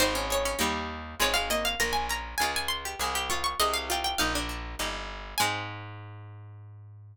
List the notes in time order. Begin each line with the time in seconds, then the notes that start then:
0.00 G#1 C4 D#4 C5
0.15 C#4
0.30 G#4 C#5
0.45 C#4
0.59 D#2 G3 A#3 D#4 G4
1.20 G#1 G#3 C4 F4 G#4 C#5
1.34 G#3 F5
1.50 A#3 D#5
1.65 F5
1.80 A#1 A#3 A#4 A#5
1.93 G#5
2.09 C#4 A#5
2.38 C#2 G#3 C#4 F4 G#5
2.56 G#5
2.68 C6
2.85 G4
2.99 C2 G#3 G#4
3.15 G4
3.30 C4 F4 C#6
3.44 C#6
3.60 C2 G#3 G#4 D#5
3.73 F5
3.90 C4 F4 G5
4.04 G5
4.18 A#1 A#3 D#4 F5
4.35 D4
4.49 D4
4.79 G1 A#3 D#4 G4
5.38 G#2 G#3 C4 D#4 G#4 G#5